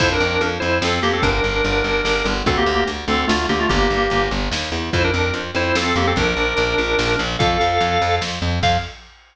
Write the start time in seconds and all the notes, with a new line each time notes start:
0.00 F2 E4 C5, kick, crash
0.12 D4 A#4
0.20 F2
0.41 F2, closed hi-hat
0.60 F2 E4 C5
0.82 F2 C4 A4, snare
1.03 F2 A#3 G4
1.13 C4 A4
1.22 G1 D4 A#4, kick, closed hi-hat
1.44 G1
1.64 G1, closed hi-hat
1.84 G1
2.05 G1, snare
2.25 G1
2.46 D2 C4 A4, kick, closed hi-hat
2.57 A#3 G4
2.66 D2
2.88 D2, closed hi-hat
3.08 D2 C4 A4
3.27 D2 A3 F4, snare
3.49 D2 A#3 G4
3.59 A3 F4
3.69 G1 A#3 G4, kick, closed hi-hat
3.90 G1
4.10 G1, closed hi-hat
4.31 G1
4.51 D#2, snare
4.72 E2
4.93 F2 E4 C5, kick, closed hi-hat
5.04 D4 A#4
5.14 F2
5.33 F2, closed hi-hat
5.55 F2 E4 C5
5.75 F2 C4 A4, snare
5.96 F2 A#3 G4
6.07 C4 A4
6.16 A#1 D4 A#4, kick, closed hi-hat
6.37 A#1
6.57 A#1, closed hi-hat
6.78 A#1
6.99 A#1, snare
7.19 A#1
7.39 F2 A4 F5, kick, closed hi-hat
7.61 F2
7.81 F2, closed hi-hat
8.02 F2
8.21 F2, snare
8.42 F2
8.63 F2 F5, kick, crash